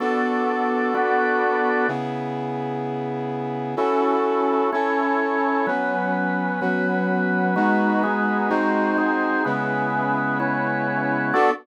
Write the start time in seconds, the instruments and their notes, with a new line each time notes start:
0.00 brass section B3 D4 F#4 A4, drawbar organ B3 F#4 A4 D5
0.94 drawbar organ B3 F#4 B4 D5
1.88 brass section C#3 B3 E4 G#4
3.76 brass section C#4 E4 F#4 A4, drawbar organ C#4 E4 F#4 A4
4.73 drawbar organ C#4 E4 A4 C#5, brass section C#4 E4 A4 C#5
5.67 drawbar organ F#3 C#4 B4, brass section F#3 B3 C#4
6.61 brass section F#3 C#4 F#4, drawbar organ F#3 B3 B4
7.56 drawbar organ G#3 D#4 F#4 B4, brass section G#3 B3 D#4 F#4
8.03 drawbar organ G#3 D#4 G#4 B4
8.50 brass section G#3 C4 D#4 F#4, drawbar organ G#3 D#4 F#4 C5
8.98 drawbar organ G#3 D#4 G#4 C5
9.45 brass section C#3 G#3 B3 E4, drawbar organ C#4 E4 G#4 B4
10.40 drawbar organ C#4 E4 B4 C#5
11.34 drawbar organ B3 F#4 A4 D5, brass section B3 D4 F#4 A4